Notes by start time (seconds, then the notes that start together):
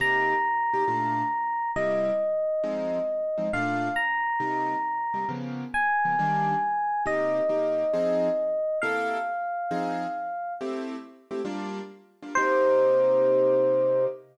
0.00 C3 A#3 D#4 G4 A#5
0.74 C3 A#3 D#4 G4
0.88 A#2 A3 D4 F4
1.76 C3 G3 A#3 E4 D#5
2.64 F3 G#3 C4 D#4
3.38 F3 G#3 C4 D#4
3.53 A#2 A3 D4 F4 F5
3.96 A#5
4.40 C3 G3 A#3 D#4
5.14 C3 G3 A#3 D#4
5.29 C#3 F3 A#3 B3
5.74 G#5
6.05 C#3 F3 A#3 B3
6.19 D#3 G3 A#3 D4
7.06 C3 A#3 D#4 G4 D#5
7.49 C3 A#3 D#4 G4
7.93 F3 C4 D#4 G#4
8.82 C3 A#3 E4 A4 F5
9.71 F3 C4 D#4 G#4
10.61 A3 C4 E4 G4
11.31 A3 C4 E4 G4
11.45 G3 A#3 D4 F4
12.23 G3 A#3 D4 F4
12.35 C3 A#3 D#4 G4 C5